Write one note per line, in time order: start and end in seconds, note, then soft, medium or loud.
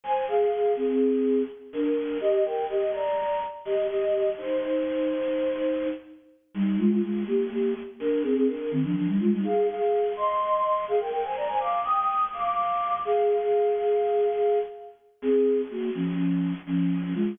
0.04 0.24 C5 medium
0.04 0.24 G#5 medium
0.28 0.72 G#4 medium
0.28 0.72 F5 medium
0.76 1.42 C4 medium
0.76 1.42 G#4 medium
1.73 2.18 D4 medium
1.73 2.18 A#4 medium
2.21 2.44 G4 medium
2.21 2.44 D#5 medium
2.45 2.64 A#4 medium
2.45 2.64 G5 medium
2.69 2.91 G4 medium
2.69 2.91 D#5 medium
2.93 3.39 D5 medium
2.93 3.39 A#5 medium
3.65 3.87 G4 medium
3.65 3.87 D#5 medium
3.89 4.30 G4 medium
3.89 4.30 D#5 medium
4.38 5.86 D#4 medium
4.38 5.86 C5 medium
6.54 6.77 G3 medium
6.54 6.77 D#4 medium
6.79 6.90 G#3 medium
6.79 6.90 F4 medium
6.90 7.02 G#3 medium
6.90 7.02 F4 medium
7.03 7.24 G#3 medium
7.03 7.24 F4 medium
7.27 7.49 A#3 medium
7.27 7.49 G4 medium
7.51 7.74 A#3 medium
7.51 7.74 G4 medium
8.00 8.22 D4 medium
8.00 8.22 A#4 medium
8.23 8.34 C4 medium
8.23 8.34 G#4 medium
8.36 8.47 C4 medium
8.36 8.47 G#4 medium
8.47 8.70 D4 medium
8.47 8.70 A#4 medium
8.71 8.83 D#3 medium
8.71 8.83 C4 medium
8.84 8.95 F3 medium
8.84 8.95 D4 medium
8.95 9.07 F3 medium
8.95 9.07 D4 medium
9.07 9.19 G3 medium
9.07 9.19 D#4 medium
9.20 9.31 G#3 medium
9.20 9.31 F4 medium
9.32 9.44 G3 medium
9.32 9.44 D#4 medium
9.44 9.67 G#4 medium
9.44 9.67 F5 medium
9.68 10.12 G#4 medium
9.68 10.12 F5 medium
10.16 10.85 D#5 medium
10.16 10.85 C6 medium
10.88 10.99 G#4 medium
10.88 10.99 F5 medium
11.00 11.11 A#4 medium
11.00 11.11 G5 medium
11.12 11.23 A#4 medium
11.12 11.23 G5 medium
11.24 11.36 C5 medium
11.24 11.36 G#5 medium
11.36 11.48 D5 medium
11.36 11.48 A#5 medium
11.48 11.60 C5 medium
11.48 11.60 G#5 medium
11.60 11.80 F5 medium
11.60 11.80 D6 medium
11.85 12.24 G5 medium
11.85 12.24 D#6 medium
12.33 12.95 F5 medium
12.33 12.95 D6 medium
13.05 14.59 G#4 medium
13.05 14.59 F5 medium
15.22 15.61 C4 medium
15.22 15.61 G#4 medium
15.71 15.90 A#3 medium
15.71 15.90 F#4 medium
15.95 16.53 F3 medium
15.95 16.53 C#4 medium
16.67 17.13 F3 medium
16.67 17.13 C#4 medium
17.15 17.35 G#3 medium
17.15 17.35 F4 medium